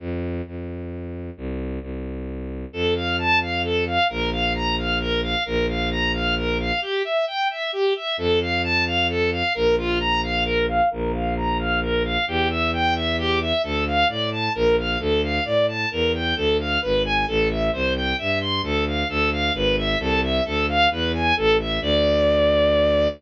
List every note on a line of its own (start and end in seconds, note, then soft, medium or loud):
0.00 0.41 F2 medium
0.47 1.30 F2 medium
1.37 1.79 C2 medium
1.81 2.65 C2 medium
2.73 3.98 F2 medium
2.73 2.94 A4 medium
2.95 3.16 F5 medium
3.18 3.39 A5 medium
3.41 3.62 F5 medium
3.64 3.84 A4 medium
3.86 4.07 F5 medium
4.09 5.35 A#1 medium
4.09 4.30 A#4 medium
4.32 4.53 F5 medium
4.55 4.75 A#5 medium
4.78 4.99 F5 medium
5.00 5.21 A#4 medium
5.23 5.44 F5 medium
5.45 6.72 A#1 medium
5.45 5.66 A#4 medium
5.68 5.89 F5 medium
5.91 6.12 A#5 medium
6.14 6.35 F5 medium
6.37 6.57 A#4 medium
6.59 6.80 F5 medium
6.82 7.02 G4 medium
7.04 7.25 E5 medium
7.27 7.48 G5 medium
7.50 7.71 E5 medium
7.72 7.93 G4 medium
7.96 8.16 E5 medium
8.17 9.43 F2 medium
8.17 8.39 A4 medium
8.41 8.62 F5 medium
8.63 8.84 A5 loud
8.86 9.07 F5 medium
9.09 9.30 A4 medium
9.32 9.53 F5 medium
9.55 10.81 A#1 medium
9.55 9.75 A#4 loud
9.78 9.98 F4 medium
10.00 10.21 A#5 loud
10.23 10.44 F5 medium
10.45 10.66 A#4 loud
10.68 10.89 F5 medium
10.91 12.17 A#1 medium
10.91 11.11 A#4 loud
11.13 11.34 F5 medium
11.36 11.57 A#5 loud
11.59 11.80 F5 medium
11.82 12.03 A#4 medium
12.04 12.25 F5 medium
12.27 13.53 E2 medium
12.27 12.48 G4 medium
12.50 12.71 E5 medium
12.73 12.94 G5 medium
12.95 13.16 E5 medium
13.18 13.39 G4 loud
13.41 13.62 E5 medium
13.63 14.04 D2 medium
13.63 13.84 A4 medium
13.87 14.08 F5 medium
14.08 14.49 A2 medium
14.08 14.30 D5 medium
14.32 14.53 A5 medium
14.55 14.97 A#1 medium
14.55 14.76 A#4 medium
14.78 14.99 F5 medium
14.99 15.40 D2 medium
14.99 15.21 A4 medium
15.23 15.44 F5 medium
15.45 15.86 A2 medium
15.45 15.66 D5 medium
15.68 15.89 A5 medium
15.91 16.34 E2 medium
15.91 16.12 A#4 medium
16.14 16.35 G5 medium
16.36 16.78 D2 medium
16.36 16.57 A4 medium
16.59 16.80 F5 medium
16.81 17.25 G#1 medium
16.81 17.02 B4 medium
17.05 17.25 G#5 medium
17.27 17.70 A1 medium
17.27 17.48 A4 medium
17.50 17.71 E5 medium
17.73 18.13 C2 medium
17.73 17.93 C5 medium
17.95 18.16 G5 medium
18.18 18.61 G2 medium
18.18 18.39 E5 medium
18.41 18.61 C6 medium
18.62 19.04 D2 medium
18.62 18.85 A4 medium
18.87 19.08 F5 medium
19.09 19.51 D2 medium
19.09 19.30 A4 loud
19.32 19.53 F5 medium
19.54 19.95 G#1 medium
19.54 19.76 B4 medium
19.77 19.98 E5 medium
19.99 20.40 C2 loud
19.99 20.21 A4 medium
20.23 20.44 E5 medium
20.45 20.87 D2 medium
20.45 20.66 A4 medium
20.68 20.89 F5 medium
20.91 21.33 E2 medium
20.91 21.12 B4 medium
21.14 21.35 G#5 medium
21.36 21.79 A1 medium
21.36 21.57 A4 medium
21.59 21.80 E5 medium
21.81 23.07 D2 loud
21.81 23.08 D5 loud